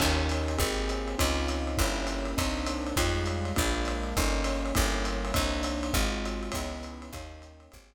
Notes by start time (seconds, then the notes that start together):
0.00 D#2 A#3 C#4 D#4 G4, kick, crash, ride
0.29 hi-hat pedal, ride
0.48 ride
0.58 G#1 A#3 C4 G4 G#4, kick, ride
0.89 hi-hat pedal, ride
1.08 ride
1.18 C#2 C4 C#4 D#4 F4, kick, ride
1.48 hi-hat pedal, ride
1.67 ride
1.78 G1 A#3 C#4 E4 G4, kick, ride
2.07 hi-hat pedal, ride
2.25 ride
2.37 C2 A#3 C4 D4 D#4, kick, ride
2.66 hi-hat pedal, ride
2.87 ride
2.96 F2 G3 G#3 D#4 F4, kick, ride
3.26 hi-hat pedal, ride
3.45 ride
3.56 A#1 G#3 A#3 D4 F4, kick, ride
3.85 hi-hat pedal, ride
4.03 ride
4.17 G1 G3 A#3 C#4 D#4, kick, ride
4.44 hi-hat pedal, ride
4.66 ride
4.75 G1 G3 A#3 C#4 E4, kick, ride
5.05 hi-hat pedal, ride
5.25 ride
5.34 C2 A#3 C4 D4 D#4, kick, ride
5.63 hi-hat pedal, ride
5.83 ride
5.93 G#1 G#3 C4 F4 F#4, kick, ride
6.25 hi-hat pedal, ride
6.43 ride
6.52 C#2 B3 C#4 D#4 E4, kick, ride
6.83 hi-hat pedal, ride
7.02 ride
7.13 D#2 A#3 C#4 D#4 G4, kick, ride
7.42 hi-hat pedal, ride
7.60 ride
7.72 G#1 A#3 C4 G4 G#4, kick, ride